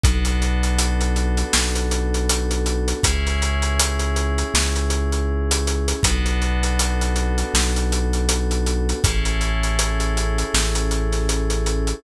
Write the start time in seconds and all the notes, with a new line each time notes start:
0.04 B1 B3 D4 F#4 A4, kick, closed hi-hat
0.25 closed hi-hat
0.42 closed hi-hat
0.63 closed hi-hat
0.79 closed hi-hat
1.01 closed hi-hat
1.16 closed hi-hat
1.37 closed hi-hat
1.53 B1, snare
1.75 closed hi-hat
1.91 closed hi-hat
2.14 closed hi-hat
2.30 closed hi-hat
2.51 closed hi-hat
2.66 closed hi-hat
2.88 closed hi-hat
3.03 C#2 C#4 E4 G#4, kick, closed hi-hat
3.27 snare, closed hi-hat
3.42 closed hi-hat
3.62 closed hi-hat
3.80 closed hi-hat
3.99 closed hi-hat
4.16 closed hi-hat
4.38 closed hi-hat
4.54 C#2, snare
4.76 closed hi-hat
4.90 closed hi-hat
5.12 closed hi-hat
5.51 closed hi-hat
5.67 closed hi-hat
5.88 closed hi-hat
6.03 B1 B3 D4 F#4 A4, kick, closed hi-hat
6.26 closed hi-hat
6.42 closed hi-hat
6.63 closed hi-hat
6.79 closed hi-hat
7.01 closed hi-hat
7.16 closed hi-hat
7.38 closed hi-hat
7.54 B1, snare
7.76 closed hi-hat
7.92 closed hi-hat
8.13 closed hi-hat
8.29 closed hi-hat
8.51 closed hi-hat
8.66 closed hi-hat
8.89 closed hi-hat
9.04 A1 C#4 E4 G#4 A4, kick, closed hi-hat
9.25 closed hi-hat
9.41 closed hi-hat
9.63 closed hi-hat
9.79 closed hi-hat
10.00 closed hi-hat
10.17 closed hi-hat
10.38 closed hi-hat
10.54 A1, snare
10.75 closed hi-hat
10.91 closed hi-hat
11.12 snare, closed hi-hat
11.29 closed hi-hat
11.50 closed hi-hat
11.66 closed hi-hat
11.87 closed hi-hat